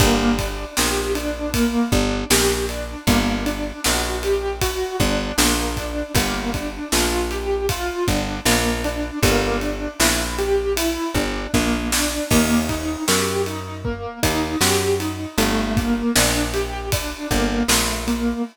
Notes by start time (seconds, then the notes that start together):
0.00 G1 A#3, kick, ride
0.39 D4, kick, ride
0.77 A#1 G4, snare
1.15 D4, ride
1.54 A#3, kick, ride
1.92 G1 D4, kick
2.30 A#1 G4, snare, ride
2.69 D4, ride
3.07 G1 A#3, kick, ride
3.46 D4, ride
3.84 A#1 F#4, snare
4.23 G4, ride
4.61 F#4, kick, ride
5.00 G1 D4, kick, ride
5.38 A#1 A#3, snare
5.77 D4, kick, ride
6.15 G1 A#3, kick, ride
6.54 D4, kick, ride
6.92 A#1 F4, snare
7.31 G4, ride
7.69 F4, kick, ride
8.08 G1 D4, kick, ride
8.46 A#1 A#3, snare
8.84 D4, ride
9.23 G1 A#3, kick, ride
9.61 D4, ride
10.00 A#1 E4, snare
10.38 G4, ride
10.77 E4, ride
11.14 G1 D4, kick, ride
11.54 A#1 A#3, kick, snare
11.92 D4, snare
12.31 D#2 A#3, kick, crash
12.69 D#4, kick, ride
13.08 F#2 G4, snare
13.46 D#4, ride
13.85 A#3, kick
14.23 D#2 D#4, kick, ride
14.61 F#2 G4, snare
15.00 D#4, ride
15.38 G1 A3, ride
15.77 A#3, kick, ride
16.15 A#1 D4, snare
16.54 G4, ride
16.92 D4, kick, ride
17.31 G1 A#3, kick, ride
17.68 A#1 A3, snare
18.08 A#3, ride